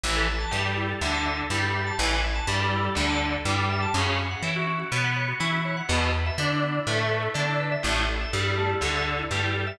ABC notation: X:1
M:4/4
L:1/16
Q:1/4=123
K:Emix
V:1 name="Overdriven Guitar"
E,2 z2 =G,4 D,4 G,4 | E,2 z2 =G,4 D,4 G,4 | C,2 z2 E4 B,4 E4 | B,,2 z2 D4 A,4 D4 |
A,,2 z2 =G,4 D,4 G,4 |]
V:2 name="Drawbar Organ"
E A e a e A E A e a e A E A e a | E A e a e A E A e a e A E A e a | C F c f c F C F c f c F C F c f | B, E B e B E B, E B e B E B, E B e |
A, E A e A E A, E A e A E A, E A e |]
V:3 name="Electric Bass (finger)" clef=bass
A,,,4 =G,,4 D,,4 G,,4 | A,,,4 =G,,4 D,,4 G,,4 | F,,4 E,4 B,,4 E,4 | E,,4 D,4 A,,4 D,4 |
A,,,4 =G,,4 D,,4 G,,4 |]